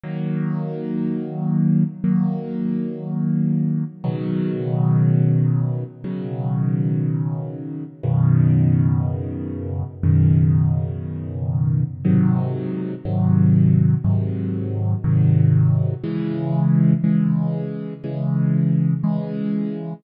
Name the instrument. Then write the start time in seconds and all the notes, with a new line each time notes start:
acoustic grand piano
0.04 D#3 F#3 A#3
2.04 D#3 F#3 A#3
4.04 B2 C#3 D#3 F#3
6.04 B2 C#3 D#3 F#3
8.04 F#2 B2 C#3 D#3
10.04 F#2 B2 C#3 D#3
12.05 G#2 C3 D#3 F#3
13.05 G#2 C3 D#3 F#3
14.04 G#2 C3 D#3 F#3
15.04 G#2 C3 D#3 F#3
16.04 C#3 E3 G#3
17.04 C#3 E3 G#3
18.04 C#3 E3 G#3
19.04 C#3 E3 G#3